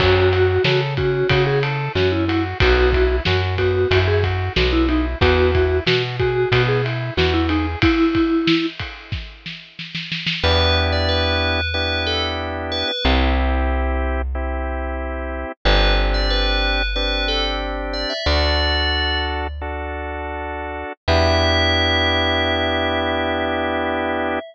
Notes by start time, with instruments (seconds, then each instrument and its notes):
0.00 electric bass (finger) F#2, drawbar organ C#4, vibraphone F#4, kick, crash
0.32 drawbar organ F#4, ride
0.64 electric bass (finger) C#3, vibraphone F#4, drawbar organ A4, snare
0.97 drawbar organ C#4, vibraphone F#4, kick, ride
1.29 electric bass (finger) C#3, drawbar organ F#4, kick, ride
1.47 vibraphone G#4
1.63 drawbar organ A4, ride
1.95 electric bass (finger) F#2, drawbar organ C#4, vibraphone F#4, snare
2.12 vibraphone E4
2.28 vibraphone E4, drawbar organ F#4, ride
2.60 electric bass (finger) B1, drawbar organ B3, vibraphone F#4, kick, ride
2.93 drawbar organ E4, kick, ride
3.25 electric bass (finger) F#2, drawbar organ F#4, vibraphone F#4, snare
3.58 drawbar organ B3, vibraphone F#4, kick, ride
3.91 electric bass (finger) F#2, drawbar organ E4, kick, ride
4.08 vibraphone G#4
4.24 drawbar organ F#4, kick, ride
4.56 electric bass (finger) B1, drawbar organ B3, vibraphone F#4, snare
4.73 vibraphone E4
4.89 vibraphone D#4, drawbar organ E4, ride
5.21 electric bass (finger) E2, drawbar organ B3, vibraphone F#4, kick, ride
5.54 drawbar organ E4, kick, ride
5.87 electric bass (finger) B2, drawbar organ F#4, vibraphone F#4, snare
6.20 vibraphone F#4, drawbar organ G#4, kick, ride
6.52 electric bass (finger) B2, drawbar organ B3, kick, ride
6.68 vibraphone G#4
6.84 drawbar organ E4, ride
7.17 electric bass (finger) E2, vibraphone F#4, drawbar organ F#4, snare
7.34 vibraphone E4
7.49 vibraphone D#4, drawbar organ G#4, ride
7.82 vibraphone E4, kick, ride
8.15 kick, ride
8.47 snare
8.79 kick, ride
9.12 kick, snare
9.46 snare
9.79 snare
9.95 snare
10.12 snare
10.26 snare
10.43 electric bass (finger) E2, drawbar organ B3 D4 E4 G4, tubular bells B4
10.92 tubular bells D5
11.09 tubular bells B4
11.74 drawbar organ B3 D4 E4 G4, tubular bells B4
12.07 tubular bells A4
12.72 tubular bells B4
12.88 tubular bells B4
13.04 electric bass (finger) C2, drawbar organ C4 E4 G4
14.35 drawbar organ C4 E4 G4
15.65 electric bass (finger) G1, drawbar organ C4 D4 G4, tubular bells B4
16.14 tubular bells D5
16.30 tubular bells B4
16.96 drawbar organ C4 D4 G4, tubular bells B4
17.28 tubular bells A4
17.93 tubular bells D5
18.10 tubular bells E5
18.26 electric bass (finger) D2, drawbar organ D4 F#4 A4, tubular bells D5
19.61 drawbar organ D4 F#4 A4
21.08 electric bass (finger) E2, drawbar organ B3 D4 E4 G4, tubular bells E5